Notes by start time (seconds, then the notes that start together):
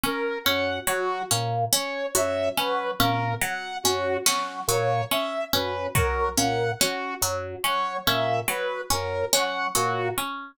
0.04 C#4 A#4
0.44 F#2 C#4 F#5
0.87 F#3 F#4
1.31 A#2 C#4, clap
1.72 C#4 C#5
2.15 F#2 F#3 E5, cowbell
2.57 F#3 C#4 B4
3.00 A#2 C#4 A#4, high tom
3.42 F#3 F#5
3.83 F#2 C#4 F#4, cowbell
4.26 F#3 C#4, snare
4.68 A#2 F#3 C#5, cowbell
5.11 C#4 E5
5.53 F#2 C#4 B4
5.95 F#3 A#4, kick
6.37 A#2 C#4 F#5, closed hi-hat
6.80 C#4 F#4, clap
7.21 F#2 F#3
7.63 F#3 C#4 C#5
8.06 A#2 C#4 E5
8.48 F#3 B4
8.90 F#2 C#4 A#4, cowbell
9.33 F#3 C#4 F#5, clap
9.75 A#2 F#3 F#4, cowbell
10.18 C#4